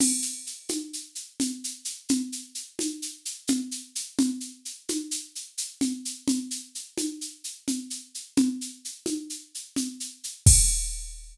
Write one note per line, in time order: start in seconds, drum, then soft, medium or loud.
0.00 crash medium
0.00 low conga medium
0.00 shaker medium
0.22 shaker medium
0.46 shaker soft
0.69 high conga medium
0.69 shaker medium
0.93 shaker medium
1.15 shaker medium
1.40 low conga medium
1.40 shaker medium
1.64 shaker medium
1.85 shaker medium
2.09 low conga medium
2.09 shaker medium
2.32 shaker medium
2.55 shaker medium
2.79 high conga medium
2.79 shaker medium
3.02 shaker medium
3.25 shaker medium
3.47 low conga medium
3.47 shaker medium
3.71 shaker medium
3.95 shaker medium
4.19 low conga medium
4.19 shaker medium
4.40 shaker soft
4.65 shaker medium
4.89 high conga medium
4.89 shaker medium
5.11 shaker medium
5.35 shaker medium
5.58 shaker medium
5.81 low conga medium
5.81 shaker medium
6.05 shaker medium
6.28 low conga medium
6.28 shaker medium
6.51 shaker medium
6.75 shaker medium
6.98 high conga medium
6.98 shaker medium
7.21 shaker medium
7.44 shaker medium
7.68 low conga medium
7.68 shaker medium
7.90 shaker medium
8.14 shaker soft
8.37 low conga medium
8.37 shaker medium
8.61 shaker medium
8.85 shaker medium
9.06 high conga medium
9.06 shaker medium
9.30 shaker medium
9.55 shaker medium
9.76 low conga medium
9.76 shaker medium
10.00 shaker medium
10.24 shaker medium
10.46 kick loud
10.46 crash loud